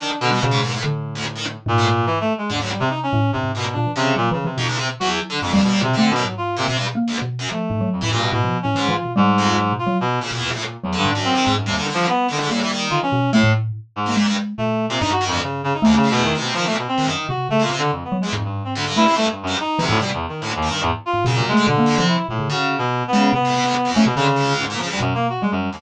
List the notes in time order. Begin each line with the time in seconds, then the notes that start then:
0.00 D#3 D4
0.21 B2 D3
0.31 B2 G3
0.41 B2 C#3
0.51 G#2
0.60 D#2 G#2
0.73 A2
0.81 A2 D3
1.15 D2
1.36 D#3
1.66 G#2 A#2
1.78 A2
2.06 E3
2.20 A3
2.38 G#3
2.50 D#2 G#2 D3
2.60 D2 F#3
2.71 G3
2.80 C3
2.90 D#4
3.03 C#4
3.13 A2
3.33 G2 C3
3.43 G#2
3.55 A#2 B2
3.73 A#2 D4
3.86 E3
3.96 C3 C#3
4.15 A#2 F#3
4.31 C#3 E3
4.45 C3 E3
4.57 F2 B2 D#4
4.68 C#2
4.79 C3
5.00 E2 F#3 F#4
5.30 D3
5.41 F2 G2 G#2
5.52 D#2 G3
5.62 D#2 B2
5.72 G3
5.82 B2 C3
5.93 D3 A3 C4
6.11 B2
6.16 F#2
6.25 G#2 F#3
6.37 F4
6.57 A#2 C3
6.68 B2 C3
6.77 G2
6.95 A#3
7.08 D2
7.22 B2
7.39 F#2
7.51 F3 A3
7.70 G#2
7.81 F#3
7.92 F2
8.01 A2 E3
8.12 G2 A#2
8.22 B2
8.32 A2 B2
8.44 F3
8.63 A2 C#4
8.75 G#2 E3
8.88 E3 F4
9.04 B2
9.16 G#2 G3
9.38 F2
9.57 F#3
9.72 B2
9.79 F4
9.87 F#3
10.01 B2
10.20 A#2 C#3
10.32 E2 B2
10.53 A2
10.84 E2 F#3
10.93 D3
10.98 G2
11.05 G#2
11.10 D4
11.15 F#2
11.24 C4
11.35 D#3
11.45 G#2
11.57 F#2
11.66 D#2 C3 G3
11.77 D3 D#3
11.88 D3
11.94 D3 F3
12.08 B3
12.28 D3 D#3
12.41 G#2
12.49 A2 G3 A#3
12.62 E3
12.72 D#3
12.90 D3 F4
13.03 E3 C#4
13.12 B2
13.33 A2 A3
13.43 A2
13.96 G#2
14.06 D#3 A#3
14.16 A#2 G#3
14.26 G2
14.58 A#2 A3
14.89 A#2 C3
15.00 G2 D#4
15.12 F#4
15.21 D#3
15.27 F2
15.31 D2
15.43 C#3
15.64 C#3
15.74 D#4
15.82 D2 D#2 A3
15.96 C#3
16.03 A2
16.11 E2 B2
16.24 D#3
16.35 C3
16.40 B2
16.54 D#3 F3
16.66 A#2 A3
16.78 B2
16.88 C4
16.98 C#2 D#3
17.07 F#2 D#3
17.29 C3 F#4
17.49 C#3 A3
17.60 A#2 F4
17.71 C3
17.78 D3
17.91 F2
18.04 B3
18.12 F#3
18.21 E2 G#3
18.33 F2 G#2
18.44 G2
18.65 C4
18.75 D2 D3
18.85 G2
18.96 A3 E4
19.07 C3
19.16 G2 A3
19.31 G2
19.43 F#2
19.47 G2
19.60 D#4
19.79 D2 C3 E3
19.89 G#2 A2
20.00 B2 C3 G3
20.14 E2
20.29 D#3
20.41 D2 A2
20.56 D#2
20.62 D#3
20.69 G2
20.82 E2 G#2
21.06 F4
21.13 G#2
21.25 F#2 B2 C#3
21.35 A#2
21.40 C3
21.48 G#3 A3
21.57 D3
21.66 B2 D3
21.78 A#3
21.86 F2
21.98 C3 F3
22.08 E4
22.29 A2 A#2
22.39 C#3
22.49 C#3 D3 F#4
22.78 B2
23.08 B3
23.13 C#3 G#3
23.33 C3 B3
23.45 A2
23.55 B2
23.64 D2
23.85 F2
23.94 A3 C#4
24.05 B2 C3
24.16 C#3 D3
24.36 C#2
24.59 G#2
24.70 A#2
24.78 C#3 F3
24.89 D2 G3
25.00 F#2 B2
25.15 A#3
25.29 F#4
25.42 G3 G#3
25.51 F#2
25.73 D#2 F2